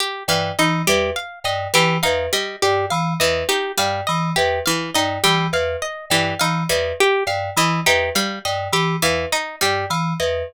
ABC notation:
X:1
M:3/4
L:1/8
Q:1/4=103
K:none
V:1 name="Electric Piano 2" clef=bass
z G,, E, E,, z G,, | E, E,, z G,, E, E,, | z G,, E, E,, z G,, | E, E,, z G,, E, E,, |
z G,, E, E,, z G,, | E, E,, z G,, E, E,, |]
V:2 name="Pizzicato Strings"
z E, ^D G, z2 | E, ^D G, z2 E, | ^D G, z2 E, D | G, z2 E, ^D G, |
z2 E, ^D G, z | z E, ^D G, z2 |]
V:3 name="Pizzicato Strings"
G f ^d G f d | G f ^d G f d | G f ^d G f d | G f ^d G f d |
G f ^d G f d | G f ^d G f d |]